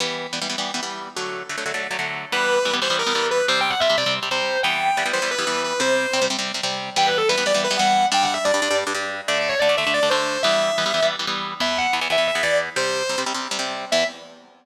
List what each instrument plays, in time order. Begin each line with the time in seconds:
0.00 overdriven guitar E3 G3 B3
0.33 overdriven guitar E3 G3 B3
0.42 overdriven guitar E3 G3 B3
0.50 overdriven guitar E3 G3 B3
0.58 overdriven guitar E3 G3 B3
0.74 overdriven guitar E3 G3 B3
0.83 overdriven guitar E3 G3 B3
1.17 overdriven guitar D3 F#3 A3
1.49 overdriven guitar D3 F#3 A3
1.58 overdriven guitar D3 F#3 A3
1.66 overdriven guitar D3 F#3 A3
1.74 overdriven guitar D3 F#3 A3
1.91 overdriven guitar D3 F#3 A3
1.99 overdriven guitar D3 F#3 A3
2.32 overdriven guitar E3 G3 B3, distortion guitar B4
2.65 overdriven guitar E3 G3 B3
2.73 overdriven guitar E3 G3 B3
2.82 overdriven guitar E3 G3 B3, distortion guitar C5
2.90 overdriven guitar E3 G3 B3
2.99 distortion guitar A#4
3.06 overdriven guitar E3 G3 B3
3.15 overdriven guitar E3 G3 B3
3.31 distortion guitar B4
3.48 overdriven guitar C3 G3 C4, distortion guitar C5
3.61 distortion guitar G5
3.70 distortion guitar F#5
3.80 overdriven guitar C3 G3 C4, distortion guitar E5
3.90 overdriven guitar C3 G3 C4
3.98 overdriven guitar C3 G3 C4, distortion guitar D5
4.06 overdriven guitar C3 G3 C4
4.23 overdriven guitar C3 G3 C4
4.31 overdriven guitar C3 G3 C4, distortion guitar C5
4.63 overdriven guitar E3 G3 B3, distortion guitar G5
4.97 overdriven guitar E3 G3 B3
5.06 overdriven guitar E3 G3 B3
5.13 overdriven guitar E3 G3 B3, distortion guitar C5
5.22 overdriven guitar E3 G3 B3
5.31 distortion guitar B4
5.38 overdriven guitar E3 G3 B3
5.47 overdriven guitar E3 G3 B3
5.64 distortion guitar B4
5.80 overdriven guitar C3 G3 C4, distortion guitar C5
6.13 overdriven guitar C3 G3 C4
6.22 overdriven guitar C3 G3 C4
6.30 overdriven guitar C3 G3 C4
6.39 overdriven guitar C3 G3 C4
6.54 overdriven guitar C3 G3 C4
6.63 overdriven guitar C3 G3 C4
6.96 overdriven guitar E3 G3 B3, distortion guitar G5
7.07 distortion guitar B4
7.18 distortion guitar A4
7.29 overdriven guitar E3 G3 B3, distortion guitar B4
7.38 overdriven guitar E3 G3 B3
7.46 overdriven guitar E3 G3 B3, distortion guitar D5
7.54 overdriven guitar E3 G3 B3
7.64 distortion guitar B4
7.71 overdriven guitar E3 G3 B3
7.77 overdriven guitar E3 G3 B3, distortion guitar F#5
8.12 overdriven guitar G2 G3 D4, distortion guitar G5
8.23 distortion guitar F#5
8.34 distortion guitar E5
8.44 overdriven guitar G2 G3 D4, distortion guitar D5
8.54 overdriven guitar G2 G3 D4
8.62 overdriven guitar G2 G3 D4
8.71 overdriven guitar G2 G3 D4
8.87 overdriven guitar G2 G3 D4
8.94 overdriven guitar G2 G3 D4
9.28 overdriven guitar D3 A3 D4, distortion guitar D5
9.38 distortion guitar D5
9.49 distortion guitar C#5
9.59 overdriven guitar D3 A3 D4, distortion guitar D5
9.69 overdriven guitar D3 A3 D4
9.77 overdriven guitar D3 A3 D4, distortion guitar E5
9.87 overdriven guitar D3 A3 D4
9.94 distortion guitar D5
10.03 overdriven guitar D3 A3 D4
10.10 overdriven guitar D3 A3 D4, distortion guitar C5
10.43 overdriven guitar E3 G3 B3, distortion guitar E5
10.78 overdriven guitar E3 G3 B3
10.86 overdriven guitar E3 G3 B3
10.94 overdriven guitar E3 G3 B3
11.02 overdriven guitar E3 G3 B3
11.19 overdriven guitar E3 G3 B3
11.27 overdriven guitar E3 G3 B3
11.60 overdriven guitar E2 E3 B3, distortion guitar E5
11.78 distortion guitar F#5
11.93 overdriven guitar E2 E3 B3
12.01 overdriven guitar E2 E3 B3
12.10 overdriven guitar E2 E3 B3, distortion guitar E5
12.18 overdriven guitar E2 E3 B3
12.27 distortion guitar E5
12.35 overdriven guitar E2 E3 B3
12.43 overdriven guitar E2 E3 B3, distortion guitar D5
12.76 overdriven guitar C3 G3 C4, distortion guitar C5
13.09 overdriven guitar C3 G3 C4
13.18 overdriven guitar C3 G3 C4
13.26 overdriven guitar C3 G3 C4
13.34 overdriven guitar C3 G3 C4
13.51 overdriven guitar C3 G3 C4
13.59 overdriven guitar C3 G3 C4
13.92 overdriven guitar E2 E3 B3, distortion guitar E5